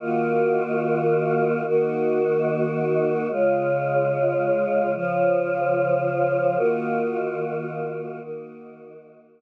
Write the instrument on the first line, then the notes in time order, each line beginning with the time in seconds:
choir aahs
0.00 D#3 A#3 F4 F#4
1.65 D#3 A#3 D#4 F#4
3.30 C#3 G#3 F4
4.95 C#3 F3 F4
6.57 D#3 A#3 F4 F#4
8.21 D#3 A#3 D#4 F#4